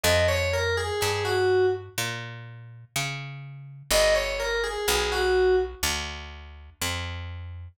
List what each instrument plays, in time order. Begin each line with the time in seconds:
0.03 electric bass (finger) F2, electric piano 2 D#5
0.28 electric piano 2 C#5
0.53 electric piano 2 A#4
0.77 electric piano 2 G#4
1.01 electric bass (finger) G2, electric piano 2 G#4
1.25 electric piano 2 F#4
1.98 electric bass (finger) A#2
2.96 electric bass (finger) C#3
3.91 electric bass (finger) G1, electric piano 2 D#5
4.15 electric piano 2 C#5
4.40 electric piano 2 A#4
4.64 electric piano 2 G#4
4.88 electric bass (finger) B1, electric piano 2 G#4
5.12 electric piano 2 F#4
5.83 electric bass (finger) D2
6.81 electric bass (finger) F2